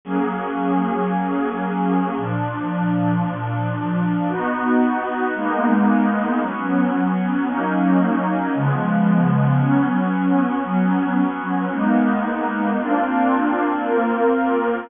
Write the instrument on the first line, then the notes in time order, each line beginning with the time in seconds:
pad 2 (warm)
0.05 F#3 A#3 C#4 G#4
2.17 A#2 F3 D4
4.28 B3 D#4 F#4
5.34 G#3 A#3 B3 D#4
6.41 F#3 B3 C#4
7.47 F#3 A#3 C#4 D#4
8.55 C#3 F3 G#3 B3
9.58 F#3 B3 C#4
10.64 F#3 B3 C#4
11.71 G#3 A#3 B3 D#4
12.79 A#3 C4 D4 F4
13.84 A#3 C4 F4 A#4